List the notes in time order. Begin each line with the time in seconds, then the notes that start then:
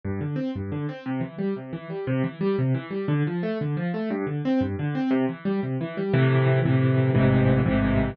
0.05 G2
0.21 D3
0.36 C4
0.55 G2
0.72 D3
0.89 C4
1.06 C3
1.21 E3
1.38 G3
1.56 C3
1.73 E3
1.90 G3
2.07 C3
2.24 E3
2.41 G3
2.58 C3
2.74 E3
2.91 G3
3.08 D3
3.27 F3
3.43 A3
3.61 D3
3.77 F3
3.94 A3
4.10 G2
4.27 D3
4.45 C4
4.61 G2
4.79 D3
4.95 C4
5.11 C3
5.29 E3
5.45 G3
5.63 C3
5.81 E3
5.97 G3
6.13 A2 C3 E3
6.65 A2 C3 E3
7.15 A1 G#2 C3 E3
7.66 A1 G#2 C3 E3